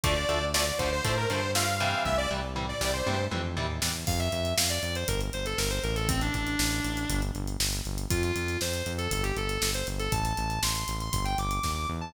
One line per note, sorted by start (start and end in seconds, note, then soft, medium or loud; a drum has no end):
0.04 0.25 D2 medium
0.04 0.14 D3 loud
0.04 0.14 F3 loud
0.04 0.14 A3 loud
0.04 0.45 D5 medium
0.04 kick loud
0.04 closed hi-hat loud
0.29 0.72 D2 medium
0.29 0.39 D3 medium
0.29 0.39 F3 medium
0.29 0.39 A3 medium
0.29 closed hi-hat medium
0.54 0.64 D3 medium
0.54 0.64 F3 loud
0.54 0.64 A3 medium
0.54 0.66 D5 medium
0.54 snare loud
0.66 0.78 D5 medium
0.79 1.01 D2 medium
0.79 0.89 D3 loud
0.79 0.89 F3 medium
0.79 0.89 A3 medium
0.79 0.91 C5 medium
0.79 kick medium
0.79 closed hi-hat medium
0.92 1.04 C5 medium
1.04 1.26 A2 medium
1.04 1.15 D3 medium
1.04 1.15 F3 medium
1.04 1.15 A3 loud
1.04 1.16 C5 medium
1.04 kick medium
1.04 closed hi-hat medium
1.17 1.29 A#4 medium
1.30 1.94 G2 medium
1.30 1.40 D3 loud
1.30 1.40 F3 medium
1.30 1.40 A3 medium
1.30 1.51 C5 medium
1.30 closed hi-hat medium
1.55 1.65 D3 medium
1.55 1.65 F3 medium
1.55 1.65 A3 medium
1.55 2.03 F5 medium
1.55 snare loud
1.80 2.16 C3 loud
1.80 2.16 E3 loud
1.80 2.16 G3 loud
1.80 closed hi-hat medium
2.05 2.27 C2 medium
2.05 2.17 E5 medium
2.05 kick medium
2.05 high tom medium
2.18 2.30 D5 medium
2.31 2.74 C2 medium
2.31 2.41 C3 medium
2.31 2.41 E3 medium
2.31 2.41 G3 medium
2.56 2.66 C3 medium
2.56 2.66 E3 medium
2.56 2.66 G3 medium
2.56 floor tom medium
2.69 2.80 D5 medium
2.81 3.03 C2 medium
2.81 2.91 C3 medium
2.81 2.91 E3 medium
2.81 2.91 G3 medium
2.81 2.93 D5 medium
2.81 snare medium
2.93 3.25 C5 medium
3.06 3.28 G2 medium
3.06 3.16 C3 medium
3.06 3.16 E3 medium
3.06 3.16 G3 medium
3.06 high tom medium
3.31 3.55 F2 medium
3.31 3.41 C3 medium
3.31 3.41 E3 loud
3.31 3.41 G3 medium
3.31 mid tom medium
3.57 3.80 D#2 medium
3.57 3.67 C3 loud
3.57 3.67 E3 medium
3.57 3.67 G3 medium
3.57 floor tom medium
3.82 4.05 E2 medium
3.82 3.92 C3 medium
3.82 3.92 E3 medium
3.82 3.92 G3 medium
3.82 snare loud
4.07 4.29 F2 loud
4.07 4.19 F5 loud
4.07 kick loud
4.07 crash medium
4.20 4.32 E5 loud
4.20 closed hi-hat medium
4.32 4.54 F2 medium
4.32 4.53 E5 medium
4.32 closed hi-hat medium
4.45 closed hi-hat medium
4.57 4.79 F2 medium
4.57 4.70 F5 medium
4.57 snare loud
4.70 4.82 D5 medium
4.70 closed hi-hat medium
4.83 5.04 F2 medium
4.83 4.95 D5 medium
4.83 closed hi-hat medium
4.95 5.08 C5 loud
4.95 closed hi-hat medium
5.08 5.30 G1 medium
5.08 5.20 A#4 loud
5.08 kick medium
5.08 closed hi-hat loud
5.21 closed hi-hat medium
5.33 5.55 G1 medium
5.33 5.46 C5 loud
5.33 closed hi-hat medium
5.46 5.58 A4 loud
5.46 closed hi-hat medium
5.58 5.80 G1 medium
5.58 5.70 A#4 loud
5.58 snare loud
5.70 5.82 C5 loud
5.70 closed hi-hat medium
5.83 6.30 A1 loud
5.83 5.95 A#4 loud
5.83 closed hi-hat medium
5.96 6.08 A4 loud
5.96 closed hi-hat medium
6.09 6.20 C4 loud
6.09 kick loud
6.09 closed hi-hat loud
6.21 6.34 D4 loud
6.21 closed hi-hat medium
6.34 6.56 A1 medium
6.34 7.20 D4 loud
6.34 kick medium
6.34 closed hi-hat medium
6.47 closed hi-hat medium
6.59 6.80 A1 medium
6.59 snare loud
6.72 closed hi-hat medium
6.85 7.06 A1 medium
6.85 closed hi-hat medium
6.97 closed hi-hat medium
7.10 7.31 G1 loud
7.10 kick medium
7.10 closed hi-hat loud
7.22 closed hi-hat medium
7.35 7.57 G1 medium
7.35 closed hi-hat medium
7.47 closed hi-hat medium
7.60 7.81 G1 medium
7.60 snare loud
7.73 closed hi-hat medium
7.85 8.07 G1 medium
7.85 closed hi-hat medium
7.98 closed hi-hat medium
8.10 8.32 F2 medium
8.10 8.22 F4 loud
8.10 kick loud
8.10 closed hi-hat loud
8.23 8.58 F4 loud
8.23 closed hi-hat medium
8.36 8.57 F2 medium
8.36 closed hi-hat medium
8.48 closed hi-hat medium
8.61 8.82 F2 medium
8.61 8.92 C5 medium
8.61 snare medium
8.74 closed hi-hat medium
8.86 9.08 F2 medium
8.86 closed hi-hat medium
8.98 9.10 A4 loud
8.98 closed hi-hat medium
9.11 9.33 G1 loud
9.11 9.24 A4 loud
9.11 kick medium
9.11 closed hi-hat loud
9.23 9.35 G4 loud
9.23 closed hi-hat medium
9.37 9.58 G1 medium
9.37 9.69 A4 loud
9.37 closed hi-hat medium
9.49 closed hi-hat medium
9.62 9.83 G1 medium
9.62 snare loud
9.74 9.87 C5 medium
9.74 closed hi-hat medium
9.87 10.08 G1 medium
9.87 closed hi-hat medium
9.99 10.11 A4 loud
9.99 closed hi-hat medium
10.12 10.34 A1 loud
10.12 10.24 A5 loud
10.12 kick loud
10.12 closed hi-hat loud
10.25 10.60 A5 loud
10.25 closed hi-hat medium
10.37 10.59 A1 medium
10.37 closed hi-hat medium
10.50 closed hi-hat medium
10.63 10.84 A1 medium
10.63 10.96 C6 medium
10.63 snare loud
10.75 closed hi-hat medium
10.88 11.09 A1 medium
10.88 closed hi-hat medium
11.00 11.12 C6 medium
11.00 closed hi-hat medium
11.13 11.35 G1 loud
11.13 11.24 C6 loud
11.13 kick medium
11.13 closed hi-hat loud
11.25 11.37 G5 loud
11.25 closed hi-hat medium
11.38 11.60 G1 medium
11.38 11.71 D6 medium
11.38 closed hi-hat medium
11.51 closed hi-hat medium
11.63 11.86 D#2 medium
11.63 kick medium
11.63 snare medium
11.76 11.88 D6 loud
11.89 12.12 E2 medium
12.01 12.13 A5 loud